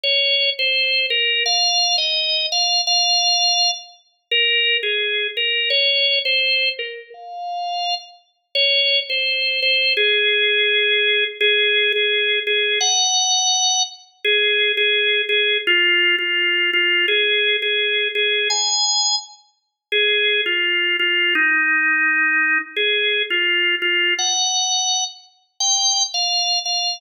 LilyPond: \new Staff { \time 4/4 \key f \minor \tempo 4 = 169 des''4. c''4. bes'4 | f''4. ees''4. f''4 | f''2~ f''8 r4. | bes'4. aes'4. bes'4 |
des''4. c''4. bes'4 | f''2~ f''8 r4. | \key aes \major des''4. c''4. c''4 | aes'1 |
aes'4. aes'4. aes'4 | ges''2. r4 | aes'4. aes'4. aes'4 | f'4. f'4. f'4 |
aes'4. aes'4. aes'4 | aes''2 r2 | aes'4. f'4. f'4 | ees'1 |
aes'4. f'4. f'4 | ges''2~ ges''8 r4. | g''4. f''4. f''4 | }